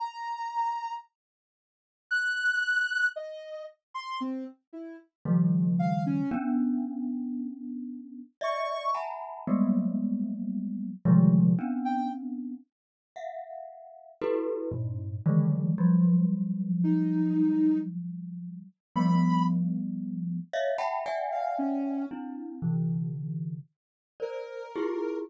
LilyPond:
<<
  \new Staff \with { instrumentName = "Glockenspiel" } { \time 3/4 \tempo 4 = 57 r2. | r2 <des ees f g a>4 | <b des' d'>2 <d'' ees'' e''>8 <e'' ges'' aes'' a'' bes'' b''>8 | <ges g aes a bes b>4. <c d ees f g aes>8 <b c' des' d'>4 |
r8 <e'' f'' ges''>4 <e' ges' g' a' b'>8 <g, a, bes,>8 <d ees e ges aes a>8 | <f ges g>2. | <f g a b>4. <des'' ees'' e'' f''>16 <e'' ges'' g'' a'' b''>16 <d'' e'' ges'' g'' aes''>4 | <c' d' e'>8 <c d e>4 r8 <bes' c'' d''>8 <e' f' g' aes'>8 | }
  \new Staff \with { instrumentName = "Ocarina" } { \time 3/4 bes''4 r4 ges'''4 | ees''8 r16 c'''16 c'16 r16 e'16 r8. f''16 des'16 | r2 des'''8 r8 | r2 r16 g''16 r8 |
r2. | r4 ees'4 r4 | b''8 r4. r16 f''16 des'8 | r2 bes'4 | }
>>